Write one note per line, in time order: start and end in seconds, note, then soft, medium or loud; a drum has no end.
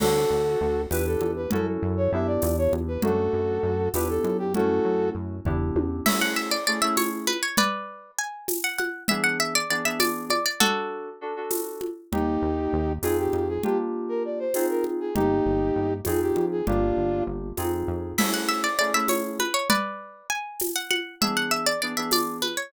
0.00 0.26 D2 medium
0.00 0.82 D4 medium
0.00 0.82 F#4 medium
0.00 0.82 A4 medium
0.00 crash medium
0.00 low conga medium
0.30 0.56 D2 medium
0.61 0.87 D2 medium
0.91 1.17 E2 medium
0.91 1.45 D4 medium
0.91 1.45 E4 medium
0.91 1.45 G4 medium
0.91 1.45 B4 medium
0.91 1.06 B4 medium
0.91 tambourine medium
0.91 high conga medium
1.06 1.31 A4 medium
1.21 1.47 E2 medium
1.21 high conga medium
1.36 1.51 B4 medium
1.51 1.78 F#2 medium
1.51 2.09 C#4 medium
1.51 2.09 E4 medium
1.51 2.09 F#4 loud
1.51 2.09 A4 medium
1.51 1.66 A4 medium
1.51 low conga medium
1.82 2.08 F#2 medium
1.97 2.11 C#5 medium
2.12 2.38 F#2 medium
2.12 2.97 B3 medium
2.12 2.97 D4 medium
2.12 2.97 E4 medium
2.12 2.97 G4 medium
2.12 2.27 E5 medium
2.27 2.56 D5 medium
2.42 2.68 E2 medium
2.42 tambourine medium
2.42 high conga medium
2.58 2.72 C#5 medium
2.72 2.98 E2 medium
2.72 high conga medium
2.88 3.02 B4 medium
3.02 3.29 F#2 medium
3.02 3.85 A3 medium
3.02 3.85 D4 medium
3.02 3.89 F#4 medium
3.02 3.85 F#4 medium
3.02 3.89 A4 medium
3.02 low conga medium
3.33 3.59 F#2 medium
3.63 3.89 F#2 medium
3.94 4.19 E2 medium
3.94 4.49 B3 medium
3.94 4.49 D4 medium
3.94 4.49 E4 medium
3.94 4.49 G4 loud
3.94 4.08 B4 medium
3.94 tambourine medium
3.94 high conga medium
4.09 4.37 A4 medium
4.24 4.80 F#2 medium
4.24 high conga medium
4.39 4.53 G4 medium
4.54 5.36 A3 medium
4.54 5.36 C#4 medium
4.54 5.36 E4 medium
4.54 5.36 F#4 medium
4.54 5.09 F#4 medium
4.54 5.09 A4 medium
4.54 low conga medium
4.85 5.11 F#2 medium
5.15 5.41 F#2 soft
5.45 5.71 E2 medium
5.45 6.00 B3 medium
5.45 6.00 D4 medium
5.45 6.00 E4 medium
5.45 6.00 G4 medium
5.45 kick medium
5.45 floor tom medium
5.76 6.01 E2 medium
5.76 high tom medium
6.06 6.55 A3 medium
6.06 6.55 C#4 medium
6.06 6.55 E4 loud
6.06 6.55 G#4 medium
6.06 6.20 E5 medium
6.06 crash loud
6.06 low conga loud
6.21 6.36 F#5 medium
6.36 6.51 E5 medium
6.51 6.66 D5 medium
6.67 6.79 A3 medium
6.67 6.79 C#4 medium
6.67 6.79 E4 medium
6.67 6.79 G#4 medium
6.67 6.81 D5 medium
6.82 7.30 A3 medium
6.82 7.30 C#4 medium
6.82 7.30 E4 medium
6.82 7.30 G#4 medium
6.82 6.96 E5 medium
6.97 7.26 C#5 medium
6.97 tambourine medium
6.97 high conga medium
7.27 7.42 B4 medium
7.27 high conga medium
7.43 7.57 C#5 medium
7.57 8.11 B4 medium
7.57 8.11 D5 medium
7.57 low conga medium
8.19 8.62 G#5 medium
8.48 tambourine medium
8.48 high conga medium
8.64 8.78 F#5 medium
8.78 9.04 F#5 medium
8.78 high conga medium
9.08 9.58 E3 medium
9.08 9.58 B3 loud
9.08 9.58 D4 medium
9.08 9.58 G#4 loud
9.08 9.23 E5 medium
9.08 low conga medium
9.24 9.38 F#5 medium
9.40 9.54 E5 medium
9.55 9.70 D5 medium
9.70 9.82 E3 medium
9.70 9.82 B3 medium
9.70 9.82 D4 medium
9.70 9.82 G#4 medium
9.70 9.85 D5 medium
9.85 10.33 E3 medium
9.85 10.33 B3 medium
9.85 10.33 D4 medium
9.85 10.33 G#4 medium
9.85 10.00 E5 medium
10.00 10.25 D5 medium
10.00 tambourine medium
10.00 high conga medium
10.30 10.45 D5 medium
10.30 high conga medium
10.46 10.60 D5 medium
10.60 11.09 D4 loud
10.60 11.10 F#4 medium
10.60 11.09 F#4 medium
10.60 11.10 A4 medium
10.60 11.09 A4 medium
10.60 low conga medium
11.21 11.33 D4 medium
11.21 11.33 F#4 medium
11.21 11.33 A4 medium
11.36 11.85 D4 medium
11.36 11.85 F#4 medium
11.36 11.85 A4 medium
11.51 tambourine medium
11.51 high conga medium
11.81 high conga medium
12.12 12.38 D#2 medium
12.12 12.94 A#3 medium
12.12 12.94 D#4 loud
12.12 12.93 D#4 medium
12.12 12.94 G4 medium
12.12 12.93 G4 medium
12.12 low conga medium
12.42 12.68 D#2 medium
12.73 12.99 D#2 medium
13.03 13.28 F2 medium
13.03 13.58 C4 medium
13.03 13.58 D#4 medium
13.03 13.58 F4 medium
13.03 13.17 G#4 medium
13.03 13.58 G#4 loud
13.03 tambourine medium
13.03 high conga medium
13.19 13.48 G4 medium
13.33 13.59 F2 medium
13.33 high conga medium
13.48 13.63 G#4 medium
13.63 14.45 A#3 medium
13.63 14.45 D4 medium
13.63 14.45 F4 medium
13.63 13.78 G4 medium
13.63 14.45 G4 medium
13.63 low conga medium
14.09 14.23 A#4 medium
14.25 14.39 D5 medium
14.39 14.66 C5 medium
14.54 15.09 C4 medium
14.54 15.09 D#4 medium
14.54 15.09 F4 medium
14.54 15.09 G#4 medium
14.54 tambourine medium
14.54 high conga medium
14.70 14.84 A#4 medium
14.84 high conga medium
15.00 15.15 G#4 medium
15.15 15.41 G1 medium
15.15 15.97 A#3 medium
15.15 15.93 D#4 medium
15.15 15.97 D#4 medium
15.15 15.93 G4 medium
15.15 15.97 G4 loud
15.15 low conga medium
15.45 15.71 G1 medium
15.76 16.02 G1 medium
16.05 16.32 F2 medium
16.05 16.60 C4 medium
16.05 16.60 D#4 medium
16.05 16.60 F4 medium
16.05 16.60 G#4 loud
16.05 16.20 G#4 medium
16.05 tambourine medium
16.05 high conga medium
16.21 16.45 G4 medium
16.36 16.62 F2 medium
16.36 high conga medium
16.52 16.66 G#4 medium
16.67 16.93 G1 medium
16.67 17.48 A#3 medium
16.67 17.48 D4 medium
16.67 17.23 D4 medium
16.67 17.48 F4 medium
16.67 17.23 F4 medium
16.67 17.48 G4 medium
16.67 low conga medium
16.97 17.22 G1 medium
17.27 17.53 G1 medium
17.57 17.84 F2 medium
17.57 18.12 C4 medium
17.57 18.12 D#4 medium
17.57 18.12 F4 medium
17.57 18.12 G#4 medium
17.57 tambourine medium
17.57 high conga medium
17.88 18.14 F2 medium
18.18 18.66 A3 medium
18.18 18.66 C#4 medium
18.18 18.66 E4 loud
18.18 18.66 G#4 medium
18.18 18.33 E5 medium
18.18 crash loud
18.18 low conga loud
18.34 18.48 F#5 medium
18.49 18.63 E5 medium
18.64 18.78 D5 medium
18.79 18.91 A3 medium
18.79 18.91 C#4 medium
18.79 18.91 E4 medium
18.79 18.91 G#4 medium
18.79 18.93 D5 medium
18.94 19.42 A3 medium
18.94 19.42 C#4 medium
18.94 19.42 E4 medium
18.94 19.42 G#4 medium
18.94 19.09 E5 medium
19.08 19.38 C#5 medium
19.08 tambourine medium
19.08 high conga medium
19.40 19.54 B4 medium
19.40 high conga medium
19.54 19.68 C#5 medium
19.70 20.27 B4 medium
19.70 20.27 D5 medium
19.70 low conga medium
20.30 20.69 G#5 medium
20.60 tambourine medium
20.60 high conga medium
20.76 20.90 F#5 medium
20.91 21.15 F#5 medium
20.91 high conga medium
21.21 21.69 E3 medium
21.21 21.69 B3 loud
21.21 21.69 D4 medium
21.21 21.69 G#4 loud
21.21 21.36 E5 medium
21.21 low conga medium
21.37 21.51 F#5 medium
21.51 21.66 E5 medium
21.66 21.81 D5 medium
21.82 21.94 E3 medium
21.82 21.94 B3 medium
21.82 21.94 D4 medium
21.82 21.94 G#4 medium
21.82 21.96 D5 medium
21.97 22.45 E3 medium
21.97 22.45 B3 medium
21.97 22.45 D4 medium
21.97 22.45 G#4 medium
21.97 22.11 E5 medium
22.11 22.38 D5 medium
22.11 tambourine medium
22.11 high conga medium
22.42 22.56 B4 medium
22.42 high conga medium
22.57 22.72 C#5 medium